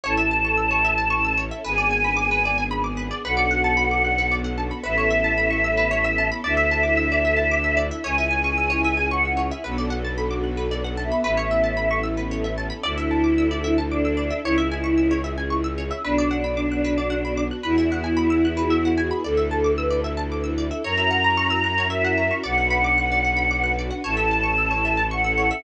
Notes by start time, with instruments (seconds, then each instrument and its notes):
0.03 violin A1, string ensemble 1 C#4 E4 A4, pizzicato strings C#5, choir aahs A5
0.17 pizzicato strings E5
0.31 pizzicato strings A5
0.45 pizzicato strings C#6
0.57 pizzicato strings E6
0.71 pizzicato strings C#5
0.85 pizzicato strings E5
0.98 pizzicato strings A5
1.10 pizzicato strings C#6
1.25 pizzicato strings E6
1.37 pizzicato strings C#5
1.51 pizzicato strings E5
1.64 violin G#1, string ensemble 1 B3 D4 G#4, pizzicato strings B4, choir aahs G#5
1.78 pizzicato strings D5
1.91 pizzicato strings G#5
2.04 pizzicato strings B5
2.17 pizzicato strings D6
2.31 pizzicato strings B4
2.45 pizzicato strings D5
2.58 pizzicato strings G#5
2.71 pizzicato strings B5
2.84 pizzicato strings D6
2.97 pizzicato strings B4
3.11 pizzicato strings D5
3.24 violin B1, string ensemble 1 B3 D4 F#4 A4, pizzicato strings B4, choir aahs F#5
3.37 pizzicato strings D5
3.51 pizzicato strings F#5
3.64 pizzicato strings A5
3.77 pizzicato strings B5
3.91 pizzicato strings D6
4.05 pizzicato strings F#6
4.18 pizzicato strings B4
4.31 pizzicato strings D5
4.44 pizzicato strings F#5
4.58 pizzicato strings A5
4.71 pizzicato strings B5
4.83 violin A1, string ensemble 1 B3 C#4 E4 A4, pizzicato strings B4, choir aahs E5
4.98 pizzicato strings C#5
5.11 pizzicato strings E5
5.24 pizzicato strings A5
5.38 pizzicato strings B5
5.50 pizzicato strings C#6
5.64 pizzicato strings E6
5.77 pizzicato strings B4
5.91 pizzicato strings C#5
6.04 pizzicato strings E5
6.18 pizzicato strings A5
6.32 pizzicato strings B5
6.44 violin D2, string ensemble 1 D4 E4 A4, pizzicato strings D5, choir aahs E5
6.57 pizzicato strings E5
6.71 pizzicato strings A5
6.83 pizzicato strings D6
6.97 pizzicato strings E6
7.12 pizzicato strings D5
7.25 pizzicato strings E5
7.37 pizzicato strings A5
7.51 pizzicato strings D6
7.64 pizzicato strings E6
7.77 pizzicato strings D5
7.91 pizzicato strings E5
8.04 violin C#2, string ensemble 1 C#4 E4 G#4, pizzicato strings C#5, choir aahs G#5
8.18 pizzicato strings E5
8.31 pizzicato strings G#5
8.44 pizzicato strings C#6
8.58 pizzicato strings E6
8.70 pizzicato strings C#5
8.84 pizzicato strings E5
8.97 pizzicato strings G#5
9.11 choir aahs F#5, pizzicato strings C#6
9.25 pizzicato strings E6
9.37 pizzicato strings C#5
9.51 pizzicato strings E5
9.64 violin B1, string ensemble 1 B3 D4 F#4 A4, pizzicato strings B4, choir aahs F#5
9.78 pizzicato strings D5
9.90 pizzicato strings F#5
10.05 pizzicato strings A5
10.18 pizzicato strings B5
10.31 pizzicato strings D6
10.44 pizzicato strings F#6
10.57 pizzicato strings B4
10.71 pizzicato strings D5
10.84 pizzicato strings F#5
10.97 choir aahs E5, pizzicato strings A5
11.12 pizzicato strings B5
11.24 violin A1, string ensemble 1 B3 C#4 E4 A4, pizzicato strings B4, choir aahs E5
11.37 pizzicato strings C#5
11.51 pizzicato strings E5
11.64 pizzicato strings A5
11.77 pizzicato strings B5
11.91 pizzicato strings C#6
12.03 pizzicato strings E6
12.17 pizzicato strings B4
12.31 pizzicato strings C#5
12.44 pizzicato strings E5
12.58 pizzicato strings A5
12.70 pizzicato strings B5
12.83 violin D2, string ensemble 1 D4 E4 A4, choir aahs E4, pizzicato strings D5
12.98 pizzicato strings E5
13.11 pizzicato strings A5
13.24 pizzicato strings D6
13.38 pizzicato strings E6
13.51 pizzicato strings D5
13.64 pizzicato strings E5
13.78 pizzicato strings A5
13.91 choir aahs D4, pizzicato strings D6
14.05 pizzicato strings E6
14.17 pizzicato strings D5
14.30 pizzicato strings E5
14.43 violin C#2, string ensemble 1 C#4 E4 G#4, choir aahs E4, pizzicato strings C#5
14.58 pizzicato strings E5
14.72 pizzicato strings G#5
14.84 pizzicato strings C#6
14.98 pizzicato strings E6
15.11 pizzicato strings C#5
15.24 pizzicato strings E5
15.38 pizzicato strings G#5
15.50 pizzicato strings C#6
15.64 pizzicato strings E6
15.78 pizzicato strings C#5
15.91 pizzicato strings E5
16.03 violin B1, string ensemble 1 B3 D4 F#4, choir aahs D4, pizzicato strings B4
16.18 pizzicato strings D5
16.31 pizzicato strings F#5
16.44 pizzicato strings B5
16.57 pizzicato strings D6
16.72 pizzicato strings F#6
16.84 pizzicato strings B4
16.98 pizzicato strings D5
17.10 pizzicato strings F#5
17.25 pizzicato strings B5
17.37 pizzicato strings D6
17.51 pizzicato strings F#6
17.63 violin E2, string ensemble 1 B3 E4 F#4 G#4, choir aahs E4, pizzicato strings B4
17.78 pizzicato strings E5
17.92 pizzicato strings F#5
18.04 pizzicato strings G#5
18.17 pizzicato strings B5
18.30 pizzicato strings E6
18.45 pizzicato strings F#6
18.57 pizzicato strings B4
18.70 pizzicato strings E5
18.85 pizzicato strings F#5
18.98 pizzicato strings G#5
19.11 pizzicato strings B5
19.24 violin D2, string ensemble 1 D4 E4 A4, choir aahs A4, pizzicato strings D5
19.37 pizzicato strings E5
19.51 pizzicato strings A5
19.64 pizzicato strings D6
19.76 choir aahs B4, pizzicato strings E6
19.90 pizzicato strings D5
20.04 pizzicato strings E5
20.17 pizzicato strings A5
20.32 pizzicato strings D6
20.44 pizzicato strings E6
20.58 pizzicato strings D5
20.71 pizzicato strings E5
20.84 violin F#2, string ensemble 1 C#4 E4 F#4 A#4, pizzicato strings C#5, choir aahs A#5
20.97 pizzicato strings E5
21.11 pizzicato strings F#5
21.24 pizzicato strings A#5
21.37 pizzicato strings C#6
21.50 pizzicato strings E6
21.64 pizzicato strings F#6
21.78 pizzicato strings C#5
21.90 pizzicato strings E5, choir aahs E5
22.04 pizzicato strings F#5
22.18 pizzicato strings A#5
22.31 pizzicato strings C#6
22.43 violin B1, string ensemble 1 D4 F#4 B4, pizzicato strings D5, choir aahs F#5
22.58 pizzicato strings F#5
22.70 pizzicato strings B5
22.84 pizzicato strings D6
22.98 pizzicato strings F#6
23.12 pizzicato strings D5
23.25 pizzicato strings F#5
23.37 pizzicato strings B5
23.51 pizzicato strings D6
23.64 pizzicato strings F#6
23.79 pizzicato strings D5
23.91 pizzicato strings F#5
24.04 violin A1, string ensemble 1 C#4 E4 A4, pizzicato strings C#5, choir aahs A5
24.17 pizzicato strings E5
24.31 pizzicato strings A5
24.43 pizzicato strings C#6
24.58 pizzicato strings E6
24.71 pizzicato strings C#5
24.85 pizzicato strings E5
24.97 pizzicato strings A5
25.11 choir aahs F#5, pizzicato strings C#6
25.24 pizzicato strings E6
25.38 pizzicato strings C#5
25.51 pizzicato strings E5